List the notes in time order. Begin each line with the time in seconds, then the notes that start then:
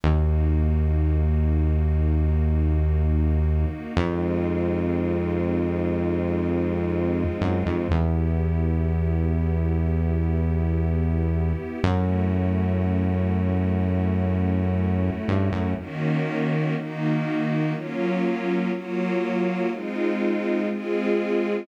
0.03 D#2 A#3 D#4 F#4
3.97 F2 G#3 C4 D#4 F4
7.41 F#2
7.66 F2
7.90 E2 B3 E4 G4
11.83 F#2 A3 C#4 E4 F#4
15.28 G2
15.52 F#2
15.77 D#3 A#3 C#4 F#4
16.76 D#3 A#3 D#4 F#4
17.73 F#3 A#3 C#4 F4
18.72 F#3 A#3 F4 F#4
19.70 G#3 C4 D#4 F4
20.69 G#3 C4 F4 G#4